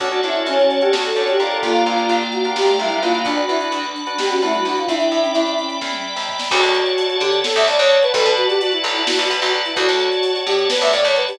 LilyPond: <<
  \new Staff \with { instrumentName = "Choir Aahs" } { \time 7/8 \key d \major \tempo 4 = 129 fis'8 e'8 cis'8. g'16 r16 a'16 cis''16 g'16 r16 a'16 | f'4. fis'8 g'8 e'8 f'8 | d'16 fis'16 e'16 r4 r16 g'16 fis'16 e'16 fis'16 fis'16 f'16 | e'4. r2 |
r2. r8 | r2. r8 | r2. r8 | }
  \new Staff \with { instrumentName = "Flute" } { \time 7/8 \key d \major fis'2 fis'4 r8 | bes2 r16 a16 g16 g16 bes16 bes16 | d'2 r16 cis'16 a16 g16 d'16 e'16 | d'8. cis'8. cis'4 r4 |
fis'4. g'8 a'16 e''16 d''16 cis''16 cis''16 b'16 | a'16 b'16 fis'16 g'16 fis'16 e'8 e'16 fis'16 fis'16 r16 fis'16 r16 e'16 | fis'4. g'8 b'16 e''16 d''16 cis''16 b'16 g'16 | }
  \new Staff \with { instrumentName = "Drawbar Organ" } { \time 7/8 \key d \major <cis' d' fis' a'>16 <cis' d' fis' a'>16 <cis' d' fis' a'>4~ <cis' d' fis' a'>16 <cis' d' fis' a'>8. <cis' d' fis' a'>8 <d' f' g' bes'>8~ | <d' f' g' bes'>16 <d' f' g' bes'>16 <d' f' g' bes'>4~ <d' f' g' bes'>16 <d' f' g' bes'>8. <d' f' g' bes'>8 <d' fis' b'>8~ | <d' fis' b'>16 <d' fis' b'>16 <d' fis' b'>4~ <d' fis' b'>16 <d' fis' b'>8. <d' fis' b'>4 | r2. r8 |
r2. r8 | r2. r8 | r2. r8 | }
  \new Staff \with { instrumentName = "Electric Bass (finger)" } { \clef bass \time 7/8 \key d \major d,8 g,8 f,4 d,8 g,8 f,8 | g,,8 c,8 bes,,4 g,,8 c,8 bes,,8 | b,,8 e,8 d,4 b,,8 e,8 d,8 | e,8 a,8 g,4 e,8. dis,8. |
d,16 d,4~ d,16 d8. d,16 d,16 d,8. | b,,16 b,4~ b,16 b,,8. b,,16 b,,16 b,,8. | d,16 d,4~ d,16 a,8. d,16 a,16 d,8. | }
  \new Staff \with { instrumentName = "Drawbar Organ" } { \time 7/8 \key d \major <cis'' d'' fis'' a''>2.~ <cis'' d'' fis'' a''>8 | <d'' f'' g'' bes''>2.~ <d'' f'' g'' bes''>8 | <d'' fis'' b''>2.~ <d'' fis'' b''>8 | <d'' e'' g'' b''>2.~ <d'' e'' g'' b''>8 |
<cis'' d'' fis'' a''>2.~ <cis'' d'' fis'' a''>8 | <b' d'' fis'' a''>2.~ <b' d'' fis'' a''>8 | <cis'' d'' fis'' a''>2.~ <cis'' d'' fis'' a''>8 | }
  \new DrumStaff \with { instrumentName = "Drums" } \drummode { \time 7/8 <hh bd>16 hh16 hh16 hh16 hh16 hh16 hh16 hh16 sn16 hh16 hh16 hh16 hh16 hh16 | <hh bd>16 hh16 hh16 hh16 hh16 hh16 hh16 hh16 sn16 hh16 hh16 hh16 hh16 hh16 | <hh bd>16 hh16 hh16 hh16 hh16 hh16 hh16 hh16 sn16 hh16 hh16 hh16 hh16 hh16 | <hh bd>16 hh16 hh16 hh16 hh16 hh16 hh16 hh16 <bd sn>16 tommh8 sn16 tomfh16 sn16 |
<cymc bd>16 hh16 hh16 hh16 hh16 hh16 hh16 hh16 sn16 hh16 hh16 hh16 hh16 hh16 | <hh bd>16 hh16 hh16 hh16 hh16 hh16 hh16 hh16 sn16 hh16 hh16 hh16 hh16 hh16 | <hh bd>16 hh16 hh16 hh16 hh16 hh16 hh16 hh16 sn16 hh16 hh16 hh16 hh16 hho16 | }
>>